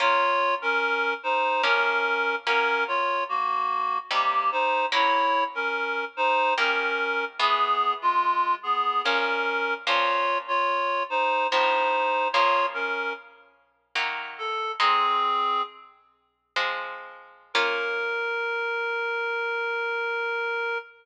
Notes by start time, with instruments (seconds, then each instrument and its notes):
0.00 orchestral harp A#3 C#4 F4, clarinet F4 C#5
0.62 clarinet C#4 A#4
1.23 clarinet D#4 C5
1.63 orchestral harp F3 A#3 C#4, clarinet C#4 A#4
2.47 orchestral harp F#3 A#3 C#4, clarinet C#4 A#4
2.88 clarinet F4 C#5
3.29 clarinet A#3 F#4
4.11 orchestral harp C3 G3 D#4, clarinet A#3 G4
4.52 clarinet D#4 C5
4.92 orchestral harp F#3 A#3 C#4 E4, clarinet E4 C#5
5.55 clarinet C#4 A#4
6.17 clarinet D#4 C5
6.58 orchestral harp D#3 G3 A#3, clarinet C#4 A#4
7.39 orchestral harp E3 G#3 B3, clarinet B3 G#4
8.02 clarinet G#3 F4
8.63 clarinet B3 G#4
9.04 orchestral harp A#2 F3 C#4, clarinet C#4 A#4
9.86 orchestral harp A#2 F3 C#4, clarinet F4 C#5
10.48 clarinet F4 C#5
11.10 clarinet D#4 C5
11.51 orchestral harp A2 F3 C4, clarinet D#4 C5
12.33 orchestral harp C#3 F3 A#3, clarinet F4 C#5
12.74 clarinet C#4 A#4
13.95 orchestral harp D#3 F#3 A#3
14.38 clarinet A4
14.79 orchestral harp G#3 C4 D#4, clarinet C4 G#4
16.56 orchestral harp F3 G#3 C4
17.54 orchestral harp A#3 C#4 F4, clarinet A#4